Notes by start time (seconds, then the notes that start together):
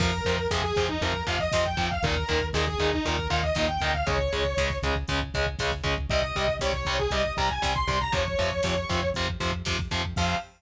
0.00 F2 C3 F3 A#4, kick, crash
0.12 kick
0.25 F2 C3 F3, kick, closed hi-hat
0.38 kick
0.51 F2 C3 F3 G#4, kick, snare
0.63 G#4, kick
0.75 F2 C3 F3, kick, snare, closed hi-hat
0.88 D#4, kick
1.01 F2 C3 F3 A#4, kick, closed hi-hat
1.14 kick
1.27 F2 C3 F3 F5, kick, closed hi-hat
1.39 D#5, kick
1.52 F2 C3 F3, kick, snare
1.65 G5, kick
1.77 F2 C3 F3 G5, kick, closed hi-hat
1.91 F5, kick
2.03 D#2 A#2 D#3 A#4, kick, closed hi-hat
2.16 kick
2.28 D#2 A#2 D#3, kick, closed hi-hat
2.41 kick
2.53 D#2 A#2 D#3 G#4, kick, snare
2.67 G#4, kick
2.78 D#2 A#2 D#3, kick, snare, closed hi-hat
2.92 D#4, kick
3.05 D#2 A#2 D#3 A#4, kick, closed hi-hat
3.19 kick
3.30 D#2 A#2 D#3 F5, kick, closed hi-hat
3.43 D#5, kick
3.55 D#2 A#2 D#3, kick, snare
3.68 G5, kick
3.80 D2 A#2 D#3 G5, kick, closed hi-hat
3.94 F5, kick
4.06 C#2 C#3 G#3 C#5, kick, closed hi-hat
4.19 kick
4.33 C#2 C#3 G#3, kick, closed hi-hat
4.45 kick
4.57 C#2 C#3 G#3, kick, snare
4.70 kick
4.82 C#2 C#3 G#3, kick, snare, closed hi-hat
4.96 kick
5.08 C#2 C#3 G#3, kick, closed hi-hat
5.22 kick
5.34 C#2 C#3 G#3, kick, closed hi-hat
5.47 kick
5.59 C#2 C#3 G#3, kick, snare
5.72 kick
5.84 C#2 C#3 G#3, kick, closed hi-hat
5.98 kick
6.10 C2 C3 G3 D#5, kick, closed hi-hat
6.22 kick
6.36 C2 C3 G3, kick, closed hi-hat
6.48 kick
6.59 C2 C3 G3 C#5, kick, snare
6.73 C#5, kick
6.85 C2 C3 G3, kick, snare, closed hi-hat
6.99 G#4, kick
7.10 C2 C3 G3 D#5, kick, closed hi-hat
7.25 kick
7.37 C2 C3 G3 A#5, kick, closed hi-hat
7.49 G#5, kick
7.62 C2 C3 G3, kick, snare
7.75 C6, kick
7.87 C2 C3 G3 C6, kick, closed hi-hat
8.01 A#5, kick
8.12 F2 C3 F3 C#5, kick, closed hi-hat
8.28 kick
8.39 F2 C3 F3, kick, closed hi-hat
8.52 kick
8.63 F2 C3 F3, kick, snare
8.76 kick
8.89 F2 C3 F3, kick, snare, closed hi-hat
9.03 kick
9.14 F2 C3 F3, kick, closed hi-hat
9.29 kick
9.40 F2 C3 F3, kick, closed hi-hat
9.52 kick
9.65 F2 C3 F3, kick, snare
9.79 kick
9.91 F2 C3 F3, kick, closed hi-hat
10.05 kick
10.16 F2 C3 F3 F5, kick, crash